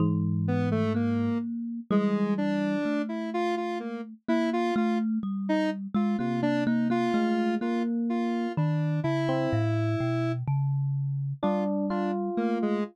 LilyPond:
<<
  \new Staff \with { instrumentName = "Kalimba" } { \time 9/8 \tempo 4. = 42 e4 ais4 g4 a4. | ais8 a8 g8. gis16 ais16 ais16 ais16 ais16 a8 ais4 | dis8 cis8 a,8 b,8 cis4 g4 a8 | }
  \new Staff \with { instrumentName = "Lead 1 (square)" } { \time 9/8 r8 b16 a16 ais8 r8 gis8 d'8. e'16 f'16 f'16 ais16 r16 | e'16 f'16 f'16 r8 dis'16 r16 f'16 f'16 d'16 dis'16 f'8. f'16 r16 f'8 | d'8 e'4. r4 f'16 r16 d'16 r16 ais16 gis16 | }
  \new Staff \with { instrumentName = "Electric Piano 1" } { \time 9/8 gis,4. r8 e4 r4. | r2 c4 gis8 ais4 | r8. c'16 r2 d'8 f'4 | }
>>